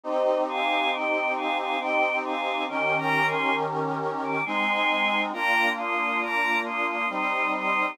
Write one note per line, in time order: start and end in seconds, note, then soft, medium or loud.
0.03 1.76 C4 medium
0.03 1.76 D#4 medium
0.03 1.76 G4 medium
0.03 0.43 C5 medium
0.03 0.43 D#5 loud
0.49 0.91 F5 medium
0.49 0.91 G#5 loud
0.92 1.34 D#5 medium
0.92 1.34 G5 medium
1.36 1.57 F5 medium
1.36 1.57 G#5 medium
1.58 1.79 F5 medium
1.58 1.79 G#5 medium
1.79 2.66 C4 medium
1.79 2.66 D#4 medium
1.79 2.66 G4 medium
1.79 2.17 D#5 medium
1.79 2.17 G5 medium
2.25 2.64 F5 medium
2.25 2.64 G#5 medium
2.68 4.41 D#3 medium
2.68 4.41 C#4 medium
2.68 4.41 G4 medium
2.68 4.41 A#4 medium
2.68 2.97 D#5 medium
2.68 2.97 G5 medium
2.98 3.26 G5 medium
2.98 3.26 A#5 medium
3.27 3.55 G#5 medium
3.27 3.55 C6 medium
4.23 4.44 D6 medium
4.45 5.32 G#3 medium
4.45 5.32 C4 medium
4.45 5.32 D#4 medium
4.45 5.20 G#5 medium
4.45 5.20 C6 loud
5.32 7.05 A#3 medium
5.32 7.05 D4 medium
5.32 7.05 F4 medium
5.32 5.69 G5 medium
5.32 5.69 A#5 loud
5.78 6.21 C6 medium
5.78 6.21 D#6 medium
6.22 6.58 A#5 medium
6.22 6.58 D6 medium
6.65 6.86 C6 medium
6.65 6.86 D#6 medium
6.88 7.08 C6 medium
6.88 7.08 D#6 medium
7.09 7.96 G3 medium
7.09 7.96 C4 medium
7.09 7.96 D#4 medium
7.09 7.51 C6 medium
7.09 7.51 D#6 medium
7.54 7.91 C6 medium
7.54 7.91 D#6 medium